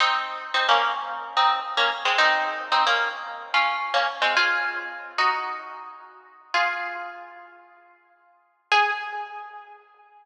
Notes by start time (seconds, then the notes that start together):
0.00 C4 D#4
0.54 C4 D#4
0.69 A#3 C#4
1.37 C4 D#4
1.77 A#3 C#4
2.05 G#3 C4
2.18 C4 D#4
2.72 C4 D#4
2.87 A#3 C#4
3.54 C#4 F4
3.94 A#3 C#4
4.22 G#3 C4
4.37 F4 G#4
5.18 D#4 F#4
6.54 F4 G#4
8.72 G#4